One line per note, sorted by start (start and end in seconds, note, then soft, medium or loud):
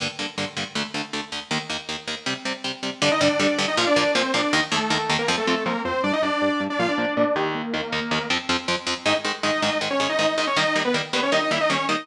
0.00 0.08 G2 medium
0.00 0.08 D3 medium
0.00 0.08 A#3 medium
0.19 0.26 G2 medium
0.19 0.26 D3 medium
0.19 0.26 A#3 medium
0.38 0.45 G2 medium
0.38 0.45 D3 medium
0.38 0.45 A#3 medium
0.57 0.64 G2 medium
0.57 0.64 D3 medium
0.57 0.64 A#3 medium
0.75 0.83 D2 medium
0.75 0.83 D3 medium
0.75 0.83 A3 medium
0.94 1.02 D2 medium
0.94 1.02 D3 medium
0.94 1.02 A3 medium
1.13 1.21 D2 medium
1.13 1.21 D3 medium
1.13 1.21 A3 medium
1.32 1.40 D2 medium
1.32 1.40 D3 medium
1.32 1.40 A3 medium
1.51 1.58 D#2 medium
1.51 1.58 D#3 medium
1.51 1.58 A#3 medium
1.70 1.77 D#2 medium
1.70 1.77 D#3 medium
1.70 1.77 A#3 medium
1.89 1.96 D#2 medium
1.89 1.96 D#3 medium
1.89 1.96 A#3 medium
2.08 2.15 D#2 medium
2.08 2.15 D#3 medium
2.08 2.15 A#3 medium
2.26 2.34 C3 medium
2.26 2.34 G3 medium
2.26 2.34 C4 medium
2.45 2.53 C3 medium
2.45 2.53 G3 medium
2.45 2.53 C4 medium
2.64 2.72 C3 medium
2.64 2.72 G3 medium
2.64 2.72 C4 medium
2.83 2.90 C3 medium
2.83 2.90 G3 medium
2.83 2.90 C4 medium
3.02 3.09 G2 loud
3.02 3.09 D3 loud
3.02 3.09 G3 loud
3.02 3.11 D4 loud
3.02 3.11 D5 loud
3.12 3.21 D#4 medium
3.12 3.21 D#5 loud
3.21 3.28 G2 medium
3.21 3.28 D3 loud
3.21 3.28 G3 loud
3.21 3.60 D4 medium
3.21 3.60 D5 loud
3.40 3.47 G2 medium
3.40 3.47 D3 loud
3.40 3.47 G3 loud
3.58 3.66 G2 loud
3.58 3.66 D3 loud
3.58 3.66 G3 medium
3.68 3.77 D#4 medium
3.68 3.77 D#5 loud
3.77 3.85 A#2 loud
3.77 3.85 F3 loud
3.77 3.85 A#3 loud
3.77 3.87 F4 loud
3.77 3.87 F5 loud
3.87 4.12 D4 loud
3.87 4.12 D5 loud
3.96 4.04 A#2 loud
3.96 4.04 F3 medium
3.96 4.04 A#3 loud
4.15 4.23 A#2 loud
4.15 4.23 F3 loud
4.15 4.23 A#3 loud
4.15 4.32 C4 medium
4.15 4.32 C5 loud
4.34 4.41 A#2 medium
4.34 4.41 F3 loud
4.34 4.41 A#3 medium
4.34 4.52 D4 medium
4.34 4.52 D5 loud
4.53 4.61 D#2 loud
4.53 4.61 D#3 loud
4.53 4.61 A#3 loud
4.53 4.62 D#4 loud
4.53 4.62 D#5 loud
4.72 4.79 D#2 loud
4.72 4.79 D#3 medium
4.72 5.12 A3 medium
4.72 4.79 A#3 medium
4.72 5.12 A4 loud
4.90 4.98 D#2 medium
4.90 4.98 D#3 medium
4.90 4.98 A#3 medium
5.10 5.17 D#2 medium
5.10 5.17 D#3 loud
5.10 5.17 A#3 medium
5.19 5.28 A#3 medium
5.19 5.28 A#4 loud
5.28 5.36 F2 loud
5.28 5.36 F3 loud
5.28 5.36 C4 loud
5.37 5.64 A3 medium
5.37 5.64 A4 loud
5.47 5.55 F2 medium
5.47 5.55 F3 medium
5.47 5.55 C4 medium
5.66 5.73 F2 medium
5.66 5.73 F3 loud
5.66 5.81 A#3 medium
5.66 5.73 C4 loud
5.66 5.81 A#4 medium
5.85 5.92 F2 loud
5.85 5.92 F3 loud
5.85 5.92 C4 loud
5.85 6.02 C4 medium
5.85 6.02 C5 loud
6.04 6.11 G2 loud
6.04 6.11 G3 loud
6.04 6.12 D4 loud
6.04 6.11 D4 loud
6.04 6.12 D5 loud
6.13 6.22 D#4 medium
6.13 6.22 D#5 loud
6.22 6.30 G2 medium
6.22 6.30 G3 loud
6.22 6.62 D4 loud
6.22 6.30 D4 medium
6.22 6.62 D5 loud
6.42 6.49 G2 medium
6.42 6.49 G3 loud
6.42 6.49 D4 medium
6.60 6.68 G2 loud
6.60 6.68 G3 medium
6.60 6.68 D4 medium
6.70 6.79 D4 medium
6.70 6.79 D5 loud
6.79 6.87 A#2 loud
6.79 6.87 F3 loud
6.79 6.87 A#3 loud
6.79 6.88 F4 loud
6.79 6.88 F5 loud
6.88 7.14 D4 medium
6.88 7.14 D5 loud
6.98 7.06 A#2 medium
6.98 7.06 F3 medium
6.98 7.06 A#3 medium
7.17 7.24 A#2 medium
7.17 7.24 F3 medium
7.17 7.24 A#3 medium
7.17 7.35 D4 medium
7.17 7.35 D5 loud
7.36 7.62 D#2 loud
7.36 7.62 D#3 loud
7.36 7.62 A#3 loud
7.36 7.53 G4 loud
7.36 7.53 G5 loud
7.55 8.25 A#3 medium
7.55 8.25 A#4 loud
7.74 7.81 D#2 medium
7.74 7.81 D#3 medium
7.74 7.81 A#3 medium
7.92 8.00 D#2 loud
7.92 8.00 D#3 medium
7.92 8.00 A#3 loud
8.11 8.19 D#2 medium
8.11 8.19 D#3 medium
8.11 8.19 A#3 medium
8.30 8.38 F2 loud
8.30 8.38 F3 loud
8.30 8.38 C4 loud
8.49 8.57 F2 loud
8.49 8.57 F3 loud
8.49 8.57 C4 loud
8.68 8.76 F2 loud
8.68 8.76 F3 loud
8.68 8.76 C4 medium
8.87 8.94 F2 loud
8.87 8.94 F3 medium
8.87 8.94 C4 loud
9.06 9.13 G#2 medium
9.06 9.13 D#3 medium
9.06 9.13 G#3 medium
9.06 9.15 D#4 loud
9.06 9.15 D#5 loud
9.25 9.32 G#2 medium
9.25 9.32 D#3 medium
9.25 9.32 G#3 medium
9.43 9.51 G#2 medium
9.43 9.51 D#3 medium
9.43 9.51 G#3 medium
9.43 9.61 D#4 medium
9.43 9.61 D#5 loud
9.62 9.70 G#2 medium
9.62 9.70 D#3 medium
9.62 9.70 G#3 loud
9.62 9.78 D#4 medium
9.62 9.78 D#5 loud
9.81 9.89 G#2 medium
9.81 9.89 D#3 medium
9.81 9.89 G#3 medium
9.91 10.00 C#4 loud
9.91 10.00 C#5 loud
10.00 10.07 G#2 medium
10.00 10.07 D#3 medium
10.00 10.07 G#3 medium
10.00 10.09 C#4 medium
10.00 10.09 C#5 loud
10.09 10.18 D#4 loud
10.09 10.18 D#5 loud
10.19 10.26 G#2 medium
10.19 10.26 D#3 medium
10.19 10.26 G#3 medium
10.19 10.35 D#4 medium
10.19 10.35 D#5 loud
10.37 10.45 G#2 medium
10.37 10.45 D#3 medium
10.37 10.45 G#3 medium
10.37 10.46 D#4 loud
10.37 10.46 D#5 loud
10.47 10.56 C#4 loud
10.47 10.56 C#5 loud
10.57 10.64 D#3 medium
10.57 10.64 G3 loud
10.57 10.64 A#3 medium
10.57 10.80 D#4 loud
10.57 10.80 D#5 loud
10.76 10.83 D#3 medium
10.76 10.83 G3 medium
10.76 10.83 A#3 medium
10.85 10.94 B3 loud
10.85 10.94 B4 loud
10.94 11.02 D#3 medium
10.94 11.02 G3 medium
10.94 11.02 A#3 medium
11.13 11.21 D#3 medium
11.13 11.21 G3 medium
11.13 11.21 A#3 medium
11.13 11.22 B3 medium
11.13 11.22 B4 medium
11.23 11.32 C#4 medium
11.23 11.32 C#5 loud
11.32 11.40 D#3 medium
11.32 11.40 G3 medium
11.32 11.40 A#3 medium
11.32 11.41 D#4 loud
11.32 11.41 D#5 loud
11.42 11.51 D#4 loud
11.42 11.51 D#5 loud
11.51 11.58 D#3 medium
11.51 11.58 G3 medium
11.51 11.58 A#3 medium
11.51 11.60 E4 medium
11.51 11.60 E5 loud
11.61 11.70 D#4 loud
11.61 11.70 D#5 loud
11.70 11.77 D#3 medium
11.70 11.77 G3 medium
11.70 11.77 A#3 medium
11.70 11.86 C#4 loud
11.70 11.86 C#5 loud
11.89 11.96 D#3 medium
11.89 11.96 G3 medium
11.89 11.96 A#3 medium
11.89 12.04 D#4 loud
11.89 12.04 D#5 loud